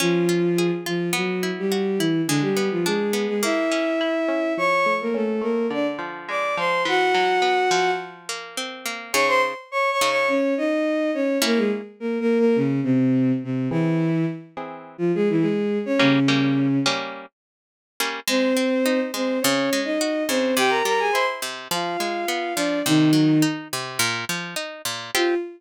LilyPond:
<<
  \new Staff \with { instrumentName = "Violin" } { \time 4/4 \key f \dorian \tempo 4 = 105 <f f'>4. <f f'>8 <fis fis'>8. <g g'>8. <e e'>8 | <d d'>16 <g g'>8 <f f'>16 <aes aes'>8. <aes aes'>16 <fes' fes''>2 | <cis'' cis'''>8. <bes bes'>16 <a a'>8 <bes bes'>8 <d' d''>16 r8. <d'' d'''>8 <c'' c'''>8 | <fis' fis''>2 r2 |
\key bes \dorian <des'' des'''>16 <c'' c'''>16 r8 \tuplet 3/2 { <des'' des'''>8 <des'' des'''>8 <des'' des'''>8 } <des' des''>8 <ees' ees''>4 <des' des''>8 | <bes bes'>16 <aes aes'>16 r8 \tuplet 3/2 { <bes bes'>8 <bes bes'>8 <bes bes'>8 } <des des'>8 <c c'>4 <c c'>8 | <e e'>4 r4 r16 <f f'>16 <gis gis'>16 <e e'>16 <gis gis'>8. <des' des''>16 | <des des'>4. r2 r8 |
\key f \dorian <c' c''>4. <c' c''>8 <des' des''>8. <ees' ees''>8. <c' c''>8 | <g' g''>16 <bes' bes''>16 <bes' bes''>16 <aes' aes''>16 <c'' c'''>16 r8. <f' f''>4. <d' d''>8 | <ees ees'>4 r2. | f'4 r2. | }
  \new Staff \with { instrumentName = "Acoustic Guitar (steel)" } { \time 4/4 \key f \dorian des'8 f'8 aes'8 f'8 b8 e'8 fis'8 e'8 | aes8 ces'8 d'8 ces'8 bes8 des'8 fes'8 des'8 | f8 a8 cis'8 a8 d8 f8 aes8 f8 | e8 fis8 b8 f4 bes8 c'8 bes8 |
\key bes \dorian <des ees' aes'>4. <des ees' aes'>2~ <des ees' aes'>8 | <bes des' fes'>1 | <e bis gis'>4. <e bis gis'>2~ <e bis gis'>8 | <g bes des'>8 <g bes des'>4 <g bes des'>2 <g bes des'>8 |
\key f \dorian aes8 c'8 ees'8 aes8 des8 aes8 ges'8 des8 | c8 g8 e'8 c8 f8 aes8 ces'8 f8 | c8 ges8 ees'8 c8 bes,8 f8 ees'8 bes,8 | <c' f' g'>4 r2. | }
>>